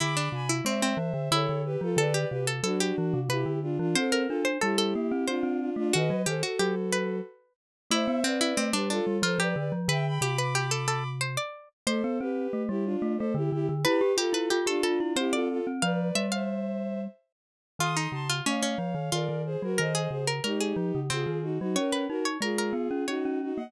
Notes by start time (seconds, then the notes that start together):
0.00 D3 E4 B5 D6
0.17 D4
0.32 C3 G#5 B5
0.49 E4
0.65 G#3 C4 C5 E5
0.82 C4
0.97 E3
1.14 D3
1.31 D3 E4 A4 C#5
1.49 D3
1.65 G4 B4
1.81 F3 F4 A4
1.97 D3 A4 B4 D5
2.14 G4
2.30 C3 G4 B4
2.47 A4
2.63 F#3 D4 F#4 A4
2.80 G4
2.98 E3
3.13 C3
3.29 C3 E4 G4 B4
3.46 D3
3.62 D4 F4
3.79 E3 D4 F4
3.95 C4 A4 C5
4.12 A#4
4.27 D4 F4 A4
4.45 C5
4.61 G3 E4 G4 A4
4.78 A4
4.95 A#3
5.12 C4
5.27 C4 D4 F4 C5
5.43 C4
5.60 D4 F4
5.76 A3 D4 F4
5.93 D#3 F#4 B4 D#5
6.10 F#3
6.26 D#3 G4 A4 C5
6.43 F#4 A4
6.59 F#3 G4
6.92 B4
7.91 A3 E4 C5 E5
8.08 B3
8.24 C4 B4 D5
8.41 E4
8.57 A3 C4
8.73 G3 D4 G4 B4
8.90 D4 F4 A4
9.07 G3
9.22 F3 F4 A4 C5
9.39 F3 G4 B4 D5
9.56 D3 B4 D5
9.72 F3
9.88 D3 B4 E5 G5
10.07 G5 B5
10.21 C3 G4 B5 D6
10.38 B4 B5 D6
10.55 G4
10.71 A4
10.88 A4
11.21 C5
11.37 D5
11.87 A3 A4 C5
12.04 B3
12.20 C4 G4 B4
12.53 A3
12.69 G3 E4 G4
12.85 D4 F4
13.02 A3
13.17 A3 A4 C5
13.34 D3 E4 G4
13.52 D3 E4 G4
13.69 D3
13.85 E4 G4 B4
14.01 G4
14.17 F4 G4 A4
14.33 E4 B4
14.50 F4 G4
14.66 D4 F4 G4 A4
14.83 D4 F4 A4
15.00 E4
15.16 C4 E4 G4 C5
15.32 F4 A4 D5
15.50 F4 A4
15.67 C4
15.81 F3 B4 D5 F5
16.15 G3 E5
16.32 C5 E5 F5
17.79 D#3 F4 C6 D#6
17.97 D#4
18.12 C#3 A5 C6
18.30 F4
18.46 A3 C#4 C#5 F5
18.63 C#4
18.78 F3
18.95 D#3
19.12 D#3 F4 A#4 D5
19.29 D#3
19.45 G#4 C5
19.62 F#3 F#4 A#4
19.78 D#3 A#4 C5 D#5
19.95 G#4
20.10 C#3 G#4 C5
20.27 A#4
20.44 G#3 D#4 G4 A#4
20.60 G#4
20.76 F3
20.95 C#3
21.10 C#3 C4 F4 G#4
21.27 D#3
21.42 D#4 F#4
21.59 F#3 D#4 F#4
21.76 C#4 A#4 C#5
21.92 B4
22.09 D#4 F#4 A#4
22.25 C#5
22.41 G#3 F4 G#4 A#4
22.58 A#4
22.73 B3
22.91 C#4
23.07 C#4 D#4 F#4 C#5
23.25 C#4
23.42 D#4 F#4
23.56 A#3 D#5 F#5